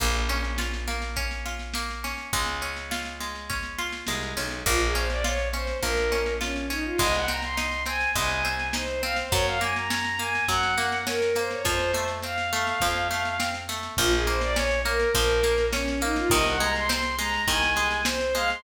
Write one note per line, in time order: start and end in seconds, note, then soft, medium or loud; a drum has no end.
0.00 2.14 A#1 medium
0.00 0.87 A#3 medium
0.00 kick medium
0.00 snare medium
0.00 crash loud
0.14 snare medium
0.29 1.16 C#4 medium
0.29 snare medium
0.44 snare medium
0.58 1.45 F4 medium
0.58 snare medium
0.74 snare medium
0.87 1.74 A#3 medium
0.87 snare medium
1.02 snare medium
1.16 2.04 C#4 medium
1.16 kick medium
1.16 snare medium
1.31 snare medium
1.46 2.29 F4 medium
1.46 snare medium
1.59 snare medium
1.74 2.30 A#3 medium
1.74 snare medium
1.90 snare medium
2.04 2.32 C#4 medium
2.04 snare medium
2.18 snare medium
2.33 3.99 C#2 medium
2.33 3.20 G#3 loud
2.33 kick medium
2.33 snare medium
2.46 snare medium
2.62 3.49 C#4 medium
2.62 snare medium
2.76 snare medium
2.91 3.78 F4 medium
2.91 snare loud
3.05 snare medium
3.21 4.07 G#3 medium
3.21 snare medium
3.35 snare medium
3.50 4.36 C#4 medium
3.50 kick medium
3.50 snare medium
3.63 snare medium
3.78 4.62 F4 medium
3.78 snare medium
3.92 snare medium
4.07 4.34 C2 medium
4.07 4.63 G#3 medium
4.07 snare medium
4.23 snare medium
4.37 4.63 B1 medium
4.37 4.64 C#4 medium
4.37 snare medium
4.51 snare medium
4.66 5.73 A#1 loud
4.66 4.92 A#3 medium
4.66 4.80 F4 medium
4.66 kick medium
4.66 snare medium
4.80 4.94 G#4 medium
4.80 snare medium
4.95 5.21 C#4 medium
4.95 5.09 C5 medium
4.95 snare medium
5.10 5.24 D5 medium
5.10 snare medium
5.24 5.51 F4 medium
5.24 5.48 C#5 medium
5.24 snare medium
5.39 snare medium
5.53 5.80 C#4 medium
5.53 5.78 C5 medium
5.53 snare medium
5.67 snare medium
5.82 6.90 A#1 medium
5.82 6.09 A#3 medium
5.82 6.33 A#4 medium
5.82 kick medium
5.82 snare medium
5.97 snare medium
6.12 6.38 C#4 medium
6.12 snare medium
6.26 snare medium
6.41 6.68 C#4 medium
6.41 6.67 F4 medium
6.41 snare medium
6.56 snare medium
6.70 6.96 C#4 medium
6.70 6.84 D#4 medium
6.70 snare medium
6.84 6.98 F4 medium
6.98 8.06 C2 medium
6.98 7.25 G#3 loud
6.98 7.13 D#5 medium
6.98 kick medium
6.98 snare medium
7.14 7.28 F#5 medium
7.14 snare medium
7.28 7.54 C4 medium
7.28 7.42 A#5 medium
7.28 snare medium
7.42 7.57 C6 medium
7.42 snare medium
7.57 7.84 D#4 medium
7.57 7.83 C6 medium
7.57 snare medium
7.72 snare medium
7.86 8.12 C4 medium
7.86 8.09 G#5 medium
7.86 snare medium
8.00 snare medium
8.15 9.23 C2 medium
8.15 8.42 G#3 medium
8.15 8.69 G#5 medium
8.15 kick medium
8.15 snare medium
8.30 snare medium
8.45 8.71 C4 medium
8.45 snare medium
8.59 snare medium
8.73 9.00 D#4 medium
8.73 9.02 C5 medium
8.73 snare loud
8.87 snare medium
9.03 9.29 C4 medium
9.03 9.17 F5 medium
9.03 snare medium
9.16 9.32 C5 medium
9.16 snare medium
9.32 10.39 F#2 medium
9.32 9.58 F#3 medium
9.32 9.46 C#5 medium
9.32 kick loud
9.32 snare medium
9.46 9.60 F5 medium
9.46 snare medium
9.61 9.87 A#3 medium
9.61 9.75 G#5 medium
9.61 snare medium
9.76 9.89 A#5 medium
9.76 snare medium
9.90 10.17 C#4 medium
9.90 10.18 A#5 medium
9.90 snare loud
10.04 snare medium
10.19 10.46 A#3 medium
10.19 10.44 G#5 medium
10.19 snare medium
10.35 snare medium
10.48 11.56 F#2 medium
10.48 10.75 F#3 medium
10.48 10.98 F#5 medium
10.48 kick medium
10.48 snare medium
10.63 snare medium
10.78 11.04 A#3 medium
10.78 snare medium
10.92 snare medium
11.07 11.33 C#4 medium
11.07 11.35 A#4 medium
11.07 snare loud
11.22 snare medium
11.35 11.62 A#3 medium
11.35 11.50 C5 medium
11.35 snare medium
11.51 11.64 C#5 medium
11.51 snare medium
11.65 12.72 F2 medium
11.65 11.91 F3 medium
11.65 12.04 C5 medium
11.65 kick medium
11.65 snare medium
11.79 snare medium
11.94 12.21 A3 medium
11.94 snare medium
12.08 snare medium
12.22 12.50 C4 medium
12.22 13.51 F5 medium
12.22 snare medium
12.38 snare medium
12.53 12.79 A3 medium
12.53 snare medium
12.67 snare medium
12.80 13.89 F2 medium
12.80 13.08 F3 medium
12.80 kick medium
12.80 snare medium
12.95 snare medium
13.11 13.37 A3 medium
13.11 snare medium
13.25 snare medium
13.40 13.66 C4 medium
13.40 snare loud
13.54 snare medium
13.69 13.95 A3 medium
13.69 snare medium
13.83 snare medium
13.97 15.05 A#1 medium
13.97 14.24 F3 loud
13.97 14.12 F4 loud
13.97 kick medium
13.97 snare medium
14.12 14.26 G#4 medium
14.12 snare medium
14.27 14.53 A#3 medium
14.27 14.41 C5 medium
14.27 snare medium
14.41 14.56 D5 medium
14.41 snare medium
14.56 14.82 C#4 medium
14.56 14.79 C#5 medium
14.56 snare loud
14.71 snare medium
14.85 15.12 A#3 medium
14.85 15.10 A#4 medium
14.85 snare medium
15.00 snare medium
15.14 16.22 A#1 medium
15.14 15.41 F3 loud
15.14 15.65 A#4 medium
15.14 kick medium
15.14 snare medium
15.29 snare medium
15.43 15.70 A#3 medium
15.43 snare medium
15.58 snare medium
15.73 15.99 C#4 medium
15.73 16.00 C#4 medium
15.73 snare loud
15.88 snare medium
16.01 16.28 A#3 medium
16.01 16.16 D#4 loud
16.01 snare medium
16.16 16.31 F4 loud
16.16 snare medium
16.30 17.38 C2 medium
16.30 16.57 D#3 loud
16.30 16.45 D#5 loud
16.30 kick loud
16.30 snare medium
16.45 16.59 F#5 medium
16.45 snare medium
16.60 16.87 G#3 medium
16.60 16.74 A#5 medium
16.60 snare medium
16.75 16.89 C6 medium
16.75 snare medium
16.89 17.16 C4 loud
16.89 17.16 C6 medium
16.89 snare loud
17.03 snare medium
17.19 17.45 G#3 medium
17.19 17.42 A#5 loud
17.19 snare medium
17.33 snare medium
17.48 18.55 C2 medium
17.48 17.74 D#3 loud
17.48 18.01 G#5 medium
17.48 kick medium
17.48 snare medium
17.63 snare medium
17.76 18.03 G#3 medium
17.76 snare medium
17.91 snare medium
18.05 18.32 C4 medium
18.05 18.34 C5 loud
18.05 snare loud
18.21 snare medium
18.35 18.61 G#3 medium
18.35 18.49 F5 loud
18.35 snare medium
18.50 18.63 C6 medium
18.50 snare medium